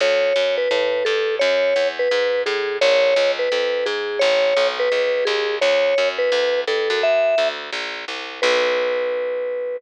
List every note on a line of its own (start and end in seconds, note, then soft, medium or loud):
0.01 0.33 D2 medium
0.01 0.56 C#5 loud
0.36 0.68 F#2 medium
0.57 1.04 B4 loud
0.71 1.03 A2 medium
1.05 1.39 G2 medium
1.05 1.35 A4 loud
1.39 1.74 F#2 medium
1.39 1.88 C#5 loud
1.76 2.08 E2 medium
1.99 2.42 B4 loud
2.11 2.44 G#2 medium
2.46 2.79 A2 medium
2.46 2.77 G#4 medium
2.81 3.14 A#1 loud
2.81 3.31 C#5 loud
3.16 3.49 C#2 medium
3.39 3.86 B4 loud
3.52 3.84 F2 medium
3.86 4.19 G#2 medium
3.86 4.20 G#4 loud
4.19 4.54 A1 loud
4.19 4.67 C#5 loud
4.57 4.89 B1 medium
4.79 5.24 B4 loud
4.92 5.24 C#2 medium
5.25 5.59 D#2 medium
5.25 5.56 G#4 loud
5.61 5.94 D2 medium
5.61 6.08 C#5 loud
5.98 6.30 F#2 medium
6.18 6.61 B4 loud
6.32 6.64 D2 medium
6.67 6.89 G2 medium
6.67 7.01 A4 loud
6.90 7.35 F#2 medium
7.03 7.48 E5 loud
7.38 7.70 D2 medium
7.73 8.05 A#1 medium
8.08 8.41 C2 medium
8.42 9.77 B1 loud
8.42 9.76 B4 loud